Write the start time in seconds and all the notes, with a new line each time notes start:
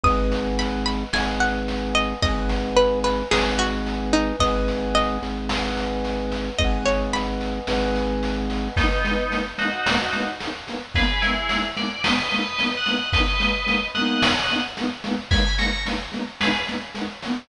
0.04 G#1 B4 D#5 D#6, kick, snare
0.08 F#5 G#5
0.32 snare
0.59 B5, snare
0.86 B5, snare
1.13 G#1 B4 D#5 G#5, snare
1.18 F#5 G#5
1.40 F#5, snare
1.68 snare
1.95 D#5, snare
2.22 G#1 B4 D#5, kick, snare
2.26 F#5 G#5
2.49 snare
2.76 B4, snare
3.04 B4, snare
3.31 G#1 G#4 B4 D#5, snare
3.37 F#5 G#5
3.58 F#4, snare
3.86 snare
4.13 D#4, snare
4.40 G#1 B4 D#5, kick, snare
4.45 F#5 G#5
4.68 snare
4.95 D#5, snare
5.22 G#1, snare
5.49 B4 D#5, snare
5.55 F#5 G#5
5.77 snare
6.04 snare
6.32 snare
6.59 G#1 B4 D#5, kick, snare
6.64 F#5 G#5
6.86 C#5, snare
7.13 B5, snare
7.41 snare
7.67 G#1 B4 D#5, snare
7.73 F#5 G#5
7.95 snare
8.23 snare
8.50 snare
8.76 G#3 A#3 B3 D#4, kick, snare
8.81 B3 D#4
9.04 G#3 A#3, snare
9.09 B3 D#4
9.30 G#3 A#3, snare
9.35 B3 D#4
9.58 G#3 A#3 D#4 F#4, snare
9.63 B3 D#4
9.86 G#3 A#3, snare
9.92 B3 D#4
10.13 G#3 A#3, snare
10.18 B3 D#4
10.40 G#3 A#3, snare
10.45 B3 D#4
10.67 G#3 A#3, snare
10.71 B3 D#4
10.95 G#3 A#3 G#4 B4, kick, snare
11.00 B3 D#4
11.22 G#3 A#3 E4 G#4, snare
11.27 B3 D#4
11.49 G#3, snare
11.53 A#3 B3
11.58 D#4
11.77 G#3 A#3 D5, snare
11.81 B3 D#4
12.04 G#3 A#3 B4 D#5, snare
12.09 B3 D#4
12.31 G#3 A#3, snare
12.36 B3 D#4 B4 D#5
12.58 G#3 A#3, snare
12.63 B3 D#4
12.77 D#5 F#5
12.86 G#3 A#3, snare
12.91 B3 D#4
13.13 G#3 A#3 B4 D#5, kick, snare
13.18 B3 D#4
13.40 G#3 A#3, snare
13.45 B3 D#4
13.67 G#3 A#3, snare
13.71 B3 D#4
13.95 G#3 A#3 D#5 F#5, snare
13.99 B3 D#4
14.22 snare
14.49 G#3 A#3, snare
14.53 B3 D#4
14.77 G#3 A#3, snare
14.81 B3 D#4
15.04 G#3 A#3, snare
15.09 B3 D#4
15.31 G#3 A#3 G#5 B5, kick, snare
15.36 B3 D#4
15.58 G#3 A#3 A#5 C#6, snare
15.64 B3 D#4
15.86 G#3 A#3, snare
15.90 B3 D#4
16.12 G#3 A#3, snare
16.16 B3 D#4
16.40 G#3 A#3 G#4 B4, snare
16.45 B3 D#4
16.67 G#3 A#3, snare
16.71 B3 D#4
16.95 G#3 A#3, snare
16.99 B3 D#4
17.23 G#3 A#3, snare
17.28 B3 D#4